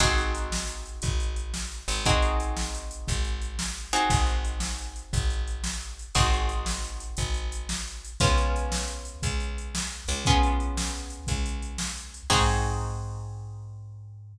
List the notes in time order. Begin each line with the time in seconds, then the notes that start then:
0.00 G#1 C4 D#4 F#4 G#4, kick, closed hi-hat
0.18 closed hi-hat
0.35 closed hi-hat
0.52 snare
0.67 closed hi-hat
0.86 closed hi-hat
1.02 G#1, kick, closed hi-hat
1.20 closed hi-hat
1.36 closed hi-hat
1.54 snare
1.72 closed hi-hat
1.88 G#1, closed hi-hat
2.05 C4 D#4 F#4 G#4, kick, closed hi-hat
2.22 closed hi-hat
2.40 closed hi-hat
2.57 snare
2.75 closed hi-hat
2.91 closed hi-hat
3.08 G#1, kick, closed hi-hat
3.24 closed hi-hat
3.42 closed hi-hat
3.59 snare
3.77 closed hi-hat
3.93 C4 D#4 F#4 G#4, closed hi-hat
4.10 G#1, kick, closed hi-hat
4.26 closed hi-hat
4.45 closed hi-hat
4.60 snare
4.78 closed hi-hat
4.96 closed hi-hat
5.13 G#1, kick, closed hi-hat
5.30 closed hi-hat
5.48 closed hi-hat
5.64 snare
5.81 closed hi-hat
5.99 closed hi-hat
6.15 G#1 C4 D#4 F#4 G#4, kick, closed hi-hat
6.33 closed hi-hat
6.49 closed hi-hat
6.66 snare
6.85 closed hi-hat
7.00 closed hi-hat
7.17 G#1, kick, closed hi-hat
7.34 closed hi-hat
7.52 closed hi-hat
7.69 snare
7.88 closed hi-hat
8.05 closed hi-hat
8.20 C#2 B3 C#4 F4 G#4, kick, closed hi-hat
8.38 closed hi-hat
8.56 closed hi-hat
8.72 snare
8.88 closed hi-hat
9.05 closed hi-hat
9.23 C#2, kick, closed hi-hat
9.40 closed hi-hat
9.58 closed hi-hat
9.75 snare
9.92 closed hi-hat
10.08 C#2, closed hi-hat
10.25 B3 C#4 F4 G#4, kick, closed hi-hat
10.43 closed hi-hat
10.60 closed hi-hat
10.77 snare
10.95 closed hi-hat
11.10 closed hi-hat
11.27 C#2, kick, closed hi-hat
11.46 closed hi-hat
11.62 closed hi-hat
11.78 snare
11.97 closed hi-hat
12.14 closed hi-hat
12.30 G#2 C4 D#4 F#4 G#4, kick, crash